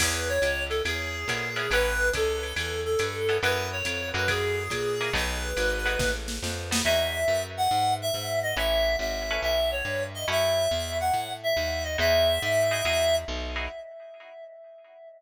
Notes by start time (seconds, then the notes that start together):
0.00 E2 B3 C#4 E4 G#4 B4, kick, crash, ride
0.28 C#5
0.42 C#2, hi-hat pedal, ride
0.69 A4, ride
0.85 E2 G#4, ride
1.28 A#2 B3 C#4 E4 G#4, kick, hi-hat pedal, ride
1.56 B3 C#4 E4 G#4, ride
1.71 A1 B3 C#4 E4 A4 B4, ride
2.13 C#2 A4, kick, hi-hat pedal, ride
2.43 ride
2.56 E2 A4, ride
2.85 A4
2.99 G2, hi-hat pedal, ride
3.29 B3 C#4 E4 A4, ride
3.43 F#2 B3 C#4 E4 F#4 B4, ride
3.72 C#5
3.85 F2, hi-hat pedal, ride
4.14 F#2 A#3 E4 F#4 G#4 B4, ride
4.28 G#4, kick, ride
4.70 A#2, kick, hi-hat pedal, ride
5.01 A#3 E4 F#4 G#4, ride
5.13 B1 A3 B3 D#4 F#4 B4, kick, ride
5.57 G#1, hi-hat pedal, ride
5.85 A3 B3 D#4 F#4, ride
5.99 A1, kick, snare
6.28 snare
6.42 F2, snare
6.71 A3 B3 D#4 F#4, snare
6.84 E2 D#4 E4 F#4 G#4 E5
7.28 F#2
7.57 F#5
7.71 G#2
8.02 E5
8.14 G#2
8.43 D#5
8.57 A1 C#4 E4 A4 B4 E5
8.99 G#1 E5
9.31 C#4 E4 A4 B4
9.42 B1 E5
9.71 C#5
9.85 G2
10.14 D#5
10.28 F#2 C#4 E4 F#4 A4 E5
10.71 E2
11.00 F#5
11.14 A2
11.43 E5
11.57 D#2
11.84 D#5
11.98 E2 D#4 E4 F#4 G#4 E5
12.42 G#2
12.71 D#4 E4 F#4 G#4
12.85 E2 D#4 E4 F#4 G#4
13.28 B1
13.56 D#4 E4 F#4 G#4